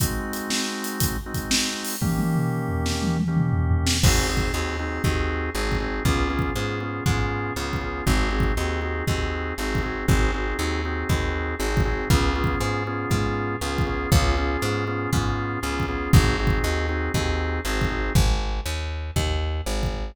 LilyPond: <<
  \new Staff \with { instrumentName = "Drawbar Organ" } { \time 4/4 \key aes \major \tempo 4 = 119 <aes c' ees' ges'>2~ <aes c' ees' ges'>8 <aes c' ees' ges'>4. | <ees bes des' g'>2~ <ees bes des' g'>8 <ees bes des' g'>4. | <c' ees' ges' aes'>8 <c' ees' ges' aes'>8 <c' ees' ges' aes'>8 <c' ees' ges' aes'>8 <c' ees' ges' aes'>4 <c' ees' ges' aes'>8 <c' ees' ges' aes'>8 | <ces' des' f' aes'>8 <ces' des' f' aes'>8 <ces' des' f' aes'>8 <ces' des' f' aes'>8 <ces' des' f' aes'>4 <ces' des' f' aes'>8 <ces' des' f' aes'>8 |
<c' ees' ges' aes'>8 <c' ees' ges' aes'>8 <c' ees' ges' aes'>8 <c' ees' ges' aes'>8 <c' ees' ges' aes'>4 <c' ees' ges' aes'>8 <c' ees' ges' aes'>8 | <c' ees' ges' aes'>8 <c' ees' ges' aes'>8 <c' ees' ges' aes'>8 <c' ees' ges' aes'>8 <c' ees' ges' aes'>4 <c' ees' ges' aes'>8 <c' ees' ges' aes'>8 | <ces' des' f' aes'>8 <ces' des' f' aes'>8 <ces' des' f' aes'>8 <ces' des' f' aes'>8 <ces' des' f' aes'>4 <ces' des' f' aes'>8 <ces' des' f' aes'>8 | <ces' des' f' aes'>8 <ces' des' f' aes'>8 <ces' des' f' aes'>8 <ces' des' f' aes'>8 <ces' des' f' aes'>4 <ces' des' f' aes'>8 <ces' des' f' aes'>8 |
<c' ees' ges' aes'>8 <c' ees' ges' aes'>8 <c' ees' ges' aes'>8 <c' ees' ges' aes'>8 <c' ees' ges' aes'>4 <c' ees' ges' aes'>8 <c' ees' ges' aes'>8 | r1 | }
  \new Staff \with { instrumentName = "Electric Bass (finger)" } { \clef bass \time 4/4 \key aes \major r1 | r1 | aes,,4 ees,4 ees,4 aes,,4 | des,4 aes,4 aes,4 des,4 |
aes,,4 ees,4 ees,4 aes,,4 | aes,,4 ees,4 ees,4 aes,,4 | des,4 aes,4 aes,4 des,4 | des,4 aes,4 aes,4 des,4 |
aes,,4 ees,4 ees,4 aes,,4 | aes,,4 ees,4 ees,4 aes,,4 | }
  \new DrumStaff \with { instrumentName = "Drums" } \drummode { \time 4/4 \tuplet 3/2 { <hh bd>8 r8 hh8 sn8 r8 hh8 <hh bd>8 r8 <hh bd>8 sn8 r8 hho8 } | \tuplet 3/2 { <bd tommh>8 tommh8 toml8 r8 tomfh8 sn8 tommh8 tommh8 toml8 tomfh8 tomfh8 sn8 } | \tuplet 3/2 { <cymc bd>8 r8 bd8 } r4 bd4 \tuplet 3/2 { r8 bd8 r8 } | \tuplet 3/2 { bd8 r8 bd8 } r4 bd4 \tuplet 3/2 { r8 bd8 r8 } |
\tuplet 3/2 { bd8 r8 bd8 } r4 bd4 \tuplet 3/2 { r8 bd8 r8 } | bd4 r4 bd4 \tuplet 3/2 { r8 bd8 r8 } | \tuplet 3/2 { bd8 r8 bd8 } r4 bd4 \tuplet 3/2 { r8 bd8 r8 } | bd4 r4 bd4 \tuplet 3/2 { r8 bd8 r8 } |
\tuplet 3/2 { bd8 r8 bd8 } r4 bd4 \tuplet 3/2 { r8 bd8 r8 } | bd4 r4 bd4 \tuplet 3/2 { r8 bd8 r8 } | }
>>